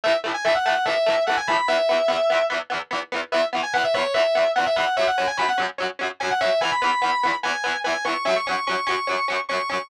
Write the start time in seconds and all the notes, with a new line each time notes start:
0.04 E3 A3 E5
0.08 A2
0.24 A2 E3 A3
0.34 G#5
0.45 A2 E3 A3 E5
0.55 F#5
0.65 E3 A3 F#5
0.70 A2
0.86 A2 E3 A3 E5
1.06 A2 E3 A3
1.27 E3 A3 F#5
1.31 A2
1.37 G#5
1.47 E3 A3 B5
1.52 A2
1.68 E3 B3 E5
1.72 E2
1.89 E2 E3 B3
2.08 E2 E3 B3
2.30 E2 E3 B3
2.50 E2 E3 B3
2.70 E2 E3 B3
2.91 E2 E3 B3
3.12 E2 E3 B3
3.32 E2 E3 B3 E5
3.53 E2 E3 B3
3.63 G#5
3.73 E3 B3 F#5
3.78 E2
3.84 E5
3.94 E3 B3 C#5
3.98 E2
4.14 E2 E3 B3 E5
4.35 E2 E3 B3
4.56 E3 B3 F#5
4.60 E2
4.66 E5
4.76 E3 B3 F#5
4.80 E2
4.97 F#3 C#4 E5
5.01 F#2
5.07 F#5
5.18 F#2 F#3 C#4
5.27 G#5
5.37 F#2 F#3 C#4 B5
5.48 F#5
5.58 F#2 F#3 C#4
5.78 F#2 F#3 C#4
5.99 F#2 F#3 C#4
6.20 F#3 C#4 G#5
6.25 F#2
6.30 F#5
6.41 F#3 C#4 E5
6.45 F#2
6.61 E3 B3 G#5
6.66 E2
6.71 B5
6.82 E2 E3 B3 B5
7.02 E2 E3 B3
7.23 E2 E3 B3
7.43 E2 E3 B3 G#5
7.64 E2 E3 B3
7.84 E2 E3 B3 G#5
8.05 E2 E3 B3 C#6
8.25 F#2 F#3 C#4 E5
8.36 C#6
8.46 F#3 C#4 C#6
8.51 F#2
8.67 F#3 C#4 C#6
8.71 F#2
8.87 F#2 F#3 C#4 C#6
9.07 F#2 F#3 C#4
9.28 F#2 F#3 C#4
9.49 F#3 C#4 C#6
9.53 F#2
9.69 F#3 C#4 C#6
9.73 F#2